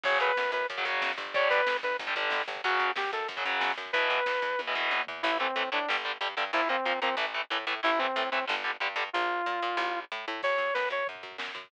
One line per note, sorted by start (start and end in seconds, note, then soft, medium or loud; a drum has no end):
0.03 0.17 F#2 medium
0.03 0.31 C#3 loud
0.03 0.31 F#3 loud
0.03 0.18 C#5 medium
0.03 kick medium
0.03 crash loud
0.13 kick medium
0.20 0.34 F#2 medium
0.20 0.51 B4 medium
0.20 kick medium
0.20 closed hi-hat medium
0.29 kick medium
0.37 0.51 F#2 medium
0.37 kick medium
0.37 snare medium
0.45 kick medium
0.52 0.66 F#2 medium
0.52 0.67 B4 medium
0.52 kick medium
0.52 closed hi-hat medium
0.61 kick medium
0.70 0.84 F#2 medium
0.70 kick medium
0.70 closed hi-hat medium
0.77 0.84 C#3 medium
0.77 0.84 F#3 medium
0.77 kick medium
0.85 0.99 F#2 medium
0.85 1.11 C#3 medium
0.85 1.11 F#3 loud
0.85 kick medium
0.85 closed hi-hat medium
0.94 kick medium
1.02 1.15 F#2 medium
1.02 kick medium
1.02 snare medium
1.10 kick medium
1.18 1.48 G1 medium
1.18 kick medium
1.18 closed hi-hat medium
1.26 kick medium
1.34 1.60 D3 loud
1.34 1.60 G3 loud
1.34 1.48 C#5 medium
1.34 kick loud
1.34 closed hi-hat medium
1.42 kick medium
1.50 1.65 G1 medium
1.50 1.77 B4 medium
1.50 kick medium
1.50 closed hi-hat medium
1.59 kick medium
1.67 1.81 G1 medium
1.67 kick medium
1.67 snare loud
1.75 kick medium
1.83 1.97 G1 medium
1.83 1.97 B4 medium
1.83 kick medium
1.83 closed hi-hat medium
1.91 kick medium
1.99 2.13 G1 medium
1.99 kick medium
1.99 closed hi-hat medium
2.07 2.13 D3 medium
2.07 2.13 G3 medium
2.07 kick medium
2.15 2.30 G1 medium
2.15 2.42 D3 medium
2.15 2.42 G3 medium
2.15 kick medium
2.15 closed hi-hat medium
2.24 kick medium
2.30 2.44 G1 medium
2.30 kick medium
2.30 snare medium
2.40 kick medium
2.48 2.61 G1 loud
2.48 kick medium
2.48 closed hi-hat medium
2.56 kick medium
2.64 2.78 F#2 loud
2.64 2.90 C#3 loud
2.64 2.90 F#3 loud
2.64 2.92 F#4 medium
2.64 kick medium
2.64 closed hi-hat loud
2.72 kick medium
2.79 2.93 F#2 medium
2.79 kick medium
2.79 closed hi-hat medium
2.88 kick medium
2.96 3.09 F#2 medium
2.96 3.11 G4 medium
2.96 kick medium
2.96 snare loud
3.05 kick medium
3.13 3.26 F#2 medium
3.13 3.28 A4 medium
3.13 kick medium
3.13 closed hi-hat medium
3.21 kick medium
3.28 3.42 F#2 medium
3.28 kick medium
3.28 closed hi-hat medium
3.37 3.43 C#3 medium
3.37 3.43 F#3 medium
3.37 kick medium
3.45 3.59 F#2 medium
3.45 3.71 C#3 medium
3.45 3.71 F#3 medium
3.45 kick medium
3.45 closed hi-hat medium
3.53 kick medium
3.61 3.74 F#2 medium
3.61 kick medium
3.61 snare medium
3.70 kick medium
3.77 3.91 F#2 medium
3.77 kick medium
3.77 closed hi-hat medium
3.86 kick medium
3.93 4.08 E2 loud
3.93 4.19 B2 loud
3.93 4.19 E3 loud
3.93 4.61 B4 medium
3.93 kick medium
3.93 closed hi-hat medium
4.02 kick medium
4.10 4.24 E2 medium
4.10 kick medium
4.10 closed hi-hat medium
4.18 kick medium
4.26 4.40 E2 medium
4.26 kick medium
4.26 snare medium
4.34 kick medium
4.42 4.56 E2 medium
4.42 kick medium
4.42 closed hi-hat medium
4.51 kick medium
4.59 4.73 E2 medium
4.59 kick medium
4.59 high tom medium
4.67 4.74 B2 medium
4.67 4.74 E3 medium
4.75 4.89 E2 medium
4.75 5.01 B2 medium
4.75 5.01 E3 medium
4.75 floor tom medium
4.91 5.05 E2 medium
4.91 high tom medium
5.07 5.22 E2 medium
5.07 floor tom loud
5.23 5.51 A1 loud
5.23 5.30 E3 loud
5.23 5.30 A3 loud
5.23 5.38 E4 loud
5.40 5.46 E3 medium
5.40 5.46 A3 medium
5.40 5.70 C4 medium
5.56 5.70 A2 medium
5.56 5.62 E3 medium
5.56 5.62 A3 medium
5.72 5.86 A2 medium
5.72 5.78 E3 medium
5.72 5.78 A3 medium
5.72 5.89 D4 medium
5.89 6.18 G1 loud
5.89 5.95 D3 medium
5.89 5.95 G3 loud
6.05 6.11 D3 medium
6.05 6.11 G3 medium
6.21 6.35 G2 loud
6.21 6.27 D3 medium
6.21 6.27 G3 medium
6.37 6.51 G2 loud
6.37 6.43 D3 medium
6.37 6.43 G3 medium
6.53 6.81 A#1 loud
6.53 6.60 F3 medium
6.53 6.60 A#3 loud
6.53 6.69 E4 loud
6.69 6.75 F3 medium
6.69 6.75 A#3 medium
6.69 7.00 C4 medium
6.85 7.00 A#2 medium
6.85 6.92 F3 medium
6.85 6.92 A#3 medium
7.02 7.15 A#2 loud
7.02 7.09 F3 medium
7.02 7.09 A#3 medium
7.02 7.15 C4 loud
7.17 7.44 A1 loud
7.17 7.24 E3 medium
7.17 7.24 A3 medium
7.34 7.41 E3 medium
7.34 7.41 A3 medium
7.50 7.65 A2 loud
7.50 7.57 E3 medium
7.50 7.57 A3 medium
7.67 7.81 A2 loud
7.67 7.73 E3 medium
7.67 7.73 A3 medium
7.83 8.12 A1 loud
7.83 7.89 E3 medium
7.83 7.89 A3 loud
7.83 7.99 E4 loud
7.99 8.06 E3 medium
7.99 8.06 A3 medium
7.99 8.30 C4 medium
8.16 8.30 A2 loud
8.16 8.22 E3 medium
8.16 8.22 A3 medium
8.31 8.46 A2 medium
8.31 8.38 E3 medium
8.31 8.38 A3 medium
8.31 8.45 C4 medium
8.47 8.77 G1 loud
8.47 8.54 D3 loud
8.47 8.54 G3 medium
8.64 8.71 D3 medium
8.64 8.71 G3 medium
8.80 8.95 G2 medium
8.80 8.87 D3 medium
8.80 8.87 G3 medium
8.96 9.10 G2 loud
8.96 9.03 D3 medium
8.96 9.03 G3 medium
9.13 9.42 A#1 loud
9.13 10.00 F4 medium
9.46 9.60 A#2 loud
9.62 9.76 A#2 loud
9.77 10.05 A1 loud
10.12 10.25 A2 loud
10.28 10.41 A2 loud
10.43 10.58 F#2 medium
10.43 10.74 C#5 medium
10.43 kick medium
10.43 crash medium
10.51 kick medium
10.58 10.72 F#2 medium
10.58 kick medium
10.58 floor tom medium
10.67 kick medium
10.74 10.90 F#2 medium
10.74 10.89 B4 medium
10.74 kick medium
10.74 snare medium
10.83 kick medium
10.90 11.04 F#2 medium
10.90 11.07 C#5 medium
10.90 kick medium
10.90 floor tom medium
10.99 kick medium
11.07 11.22 F#2 medium
11.07 kick medium
11.07 floor tom medium
11.15 kick medium
11.23 11.37 F#2 medium
11.23 kick medium
11.23 floor tom medium
11.32 kick medium
11.38 11.52 F#2 medium
11.38 kick medium
11.38 snare medium
11.48 kick medium
11.55 11.68 F#2 medium
11.55 kick medium
11.55 floor tom medium
11.64 kick medium